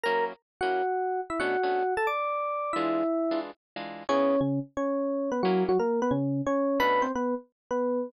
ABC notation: X:1
M:4/4
L:1/8
Q:"Swing" 1/4=178
K:A
V:1 name="Electric Piano 1"
[^A^a] z2 [Ff]4 [Ee] | [Ff]3 [Aa] [dd']4 | [Ee]4 z4 | [Cc]2 [C,C] z [Cc]3 [B,B] |
[F,F] [F,F] [^A,^A] [B,B] [C,C]2 [Cc]2 | [Bb] [=C=c] [B,B] z2 [B,B]3 |]
V:2 name="Acoustic Guitar (steel)"
[F,^A,CE]3 [F,A,CE]5 | [B,,A,CD] [B,,A,CD]7 | [E,G,D=F]3 [E,G,DF]3 [E,G,DF]2 | [C,B,EG]8 |
[F,^A,CE]8 | [B,,A,CD]8 |]